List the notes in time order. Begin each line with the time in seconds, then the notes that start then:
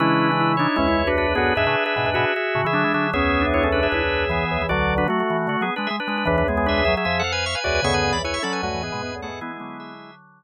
0.00 C#3 E3 G#3 C#4 D4 E4 B4
0.32 G#3 E4
0.40 E4
0.57 D4 D#4 E4 C#5
0.76 C#2 E2 G#3 C#4 E4
0.88 E4
1.07 D4 F#4 B4
1.17 D4 F#4 B4
1.35 D2 F#2 B3 F#4 G#4
1.55 E2 G#2 D4 G#4 B4 E5
1.66 A2 C#3 D4 B4
1.86 G#4 E5
1.96 G#2 B2 D4 B4
2.06 E2 G#2 D4 B4
2.14 G#2 B2 F#4 G#4 E5
2.36 G#4 E5
2.55 A2 C#3
2.65 C#3 E3 G#4 E5
2.73 D3 F#3 D4
2.84 E3 G#3
2.94 D3 F#3 G#4 E5
3.13 C#2 E2 B3 C#4 G#4 E5
3.41 D4
3.54 E4 C#5
3.63 C#4 A4
3.72 D4 B4
3.83 G#4 E5
3.92 C#2 E2 E4 G#4 E5
4.29 E3 B3 G#4
4.51 C#2 E2
4.62 E3
4.69 B1 D2 D3 F#3 F#4 D5
4.98 D4 B4
5.08 F#3 A3 F#4
5.20 A3 F#4
5.30 E3
5.47 D3 A3 F#4
5.61 F#3 B3 G#4
5.76 G#3 D4 B4
5.87 G#3 G#4 E5
6.00 D4 B4
6.07 G#3 D4 B4
6.18 D4 B4
6.25 C#2 E2 E3 D4 B4
6.38 D4 B4
6.48 G#3 B3 G#4
6.57 B3 G#4
6.66 D4 G#4 B4 E5
6.77 G#4 E5
6.85 F#3 G#4 E5
6.97 G#4 E5
7.05 F2 F3 G#4 E5
7.19 A4 F#5
7.24 F5
7.32 B4 G#5
7.46 E5 C#6
7.55 B4 G#5
7.64 C#2 E2 F#4 B4 D5 G#5
7.74 B4 G#5
7.82 D2 F#2 C#3 B3 G#4 E5 C#6
7.94 D3 B4 G#5
8.04 C#3
8.12 C#2 E2 E3 D5 B5
8.24 E4 B4 C#5 G#5
8.34 E5 C#6
8.43 F#3 C#4 A4 D5 B5
8.53 B4 G#5
8.63 D2 F#2 A3 F#4 B4 G#5
8.74 E3
8.82 E2 G#2 B3 G#4
8.92 G#2 B2 G#3
9.02 E2 G#2 B3
9.15 D2 F#2
9.22 A3 B3 G#4 A4 F#5
9.28 E2 G#2
9.41 E3 G#3 B3 E4 G#4
9.60 D3 F#3 B3
9.80 G#4 E5